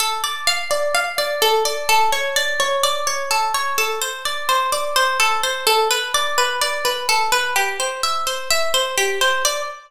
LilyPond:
\new Staff { \time 4/4 \key d \minor \tempo 4 = 127 a'8 d''8 f''8 d''8 f''8 d''8 a'8 d''8 | a'8 cis''8 d''8 cis''8 d''8 cis''8 a'8 cis''8 | a'8 c''8 d''8 c''8 d''8 c''8 a'8 c''8 | a'8 b'8 d''8 b'8 d''8 b'8 a'8 b'8 |
g'8 c''8 e''8 c''8 e''8 c''8 g'8 c''8 | d''4 r2. | }